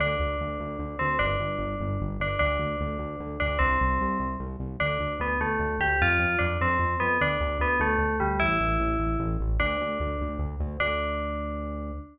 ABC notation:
X:1
M:6/8
L:1/8
Q:3/8=100
K:Ddor
V:1 name="Tubular Bells"
D5 C | D5 D | D5 D | C4 z2 |
D2 B, A,2 G | F2 D C2 B, | D2 B, A,2 G, | E5 z |
D4 z2 | D6 |]
V:2 name="Synth Bass 1" clef=bass
D,, D,, D,, D,, D,, D,, | G,,, G,,, G,,, G,,, G,,, G,,, | D,, D,, D,, D,, D,, D,, | C,, C,, C,, C,, C,, C,, |
D,, D,, D,, D,, D,, D,, | F,, F,, F,, F,, F,, F,, | D,, D,, D,, D,, D,, D,, | A,,, A,,, A,,, A,,, A,,, A,,, |
D,, D,, D,, D,, D,, D,, | D,,6 |]